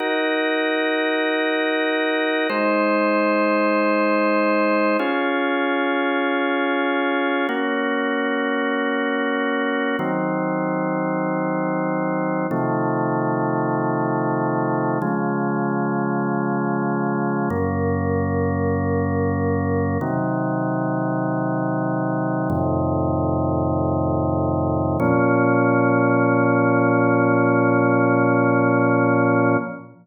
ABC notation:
X:1
M:4/4
L:1/8
Q:1/4=48
K:Bbm
V:1 name="Drawbar Organ"
[EGB]4 [A,Ec]4 | [DFA]4 [B,DG]4 | [E,G,C]4 [C,E,F,=A,]4 | [D,F,A,]4 [G,,D,B,]4 |
[C,E,G,]4 [F,,=A,,C,E,]4 | [B,,F,D]8 |]